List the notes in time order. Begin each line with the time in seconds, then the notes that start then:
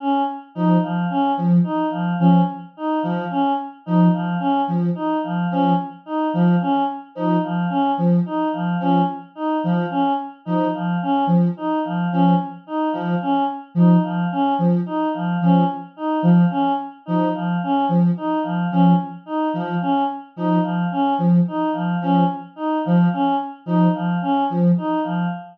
0.00 C#4
0.55 F3 D#4
0.83 F3
1.10 C#4
1.37 F3
1.64 D#4
1.91 F3
2.19 F3 C#4
2.77 D#4
3.02 F3
3.30 C#4
3.86 F3 D#4
4.13 F3
4.39 C#4
4.68 F3
4.95 D#4
5.24 F3
5.51 F3 C#4
6.06 D#4
6.33 F3
6.61 C#4
7.15 F3 D#4
7.44 F3
7.69 C#4
7.98 F3
8.26 D#4
8.53 F3
8.80 F3 C#4
9.35 D#4
9.64 F3
9.90 C#4
10.45 F3 D#4
10.74 F3
11.02 C#4
11.27 F3
11.57 D#4
11.85 F3
12.12 F3 C#4
12.67 D#4
12.92 F3
13.22 C#4
13.75 F3 D#4
14.03 F3
14.32 C#4
14.59 F3
14.86 D#4
15.14 F3
15.41 F3 C#4
15.97 D#4
16.23 F3
16.50 C#4
17.06 F3 D#4
17.35 F3
17.63 C#4
17.89 F3
18.17 D#4
18.43 F3
18.71 F3 C#4
19.26 D#4
19.54 F3
19.81 C#4
20.36 F3 D#4
20.63 F3
20.92 C#4
21.18 F3
21.48 D#4
21.73 F3
22.01 F3 C#4
22.56 D#4
22.85 F3
23.13 C#4
23.66 F3 D#4
23.94 F3
24.22 C#4
24.50 F3
24.78 D#4
25.04 F3